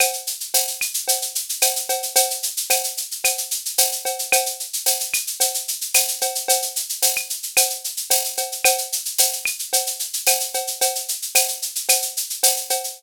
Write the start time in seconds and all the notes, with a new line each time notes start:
0.00 cowbell, claves, shaker
0.13 shaker
0.27 shaker
0.40 shaker
0.54 tambourine, cowbell, shaker
0.68 shaker
0.81 claves, shaker
0.94 shaker
1.08 cowbell, shaker
1.22 shaker
1.35 shaker
1.49 shaker
1.61 tambourine, cowbell, claves, shaker
1.76 shaker
1.89 cowbell, shaker
2.03 shaker
2.16 cowbell, shaker
2.30 shaker
2.43 shaker
2.57 shaker
2.70 tambourine, cowbell, claves, shaker
2.84 shaker
2.97 shaker
3.11 shaker
3.24 cowbell, claves, shaker
3.38 shaker
3.51 shaker
3.65 shaker
3.78 tambourine, cowbell, shaker
3.92 shaker
4.05 cowbell, shaker
4.19 shaker
4.32 cowbell, claves, shaker
4.46 shaker
4.60 shaker
4.73 shaker
4.86 tambourine, cowbell, shaker
5.00 shaker
5.14 claves, shaker
5.27 shaker
5.40 cowbell, shaker
5.54 shaker
5.68 shaker
5.81 shaker
5.94 tambourine, cowbell, claves, shaker
6.08 shaker
6.21 cowbell, shaker
6.35 shaker
6.48 cowbell, shaker
6.62 shaker
6.76 shaker
6.89 shaker
7.02 tambourine, cowbell, shaker
7.16 claves, shaker
7.30 shaker
7.43 shaker
7.57 cowbell, claves, shaker
7.70 shaker
7.84 shaker
7.97 shaker
8.10 tambourine, cowbell, shaker
8.25 shaker
8.37 cowbell, shaker
8.52 shaker
8.65 cowbell, claves, shaker
8.78 shaker
8.92 shaker
9.05 shaker
9.18 tambourine, cowbell, shaker
9.33 shaker
9.45 claves, shaker
9.59 shaker
9.73 cowbell, shaker
9.86 shaker
9.99 shaker
10.13 shaker
10.27 tambourine, cowbell, claves, shaker
10.40 shaker
10.54 cowbell, shaker
10.67 shaker
10.81 cowbell, shaker
10.95 shaker
11.08 shaker
11.22 shaker
11.35 tambourine, cowbell, claves, shaker
11.48 shaker
11.62 shaker
11.75 shaker
11.89 cowbell, claves, shaker
12.02 shaker
12.17 shaker
12.30 shaker
12.43 tambourine, cowbell, shaker
12.57 shaker
12.70 cowbell, shaker
12.84 shaker